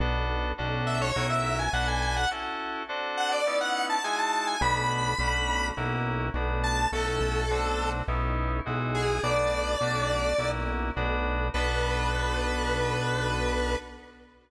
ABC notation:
X:1
M:4/4
L:1/16
Q:1/4=104
K:Bdor
V:1 name="Lead 1 (square)"
z6 e c2 e2 g f g g f | z6 f d2 f2 a g a a g | b b7 z6 a2 | A A7 z6 G2 |
d10 z6 | B16 |]
V:2 name="Electric Piano 2"
[B,DFA]4 [CDFA]4 [CEF^A]4 [DF=AB]4 | [CEFA]4 [=CDFA]4 [B,^C^DE]4 [G,DEF]4 | [A,B,DF]4 [A,CDF]4 [^A,CEF]4 [=A,B,DF]4 | [A,CEF]4 [A,=CDF]4 [B,^C^DE]4 [G,DEF]4 |
[A,B,DF]4 [A,CDF]4 [^A,CEF]4 [=A,B,DF]4 | [B,DFA]16 |]
V:3 name="Synth Bass 1" clef=bass
B,,,4 B,,,4 B,,,4 B,,,4 | z16 | B,,,4 B,,,4 B,,,4 B,,,4 | B,,,2 B,,,6 B,,,4 B,,,4 |
B,,,4 B,,,4 B,,,4 B,,,4 | B,,,16 |]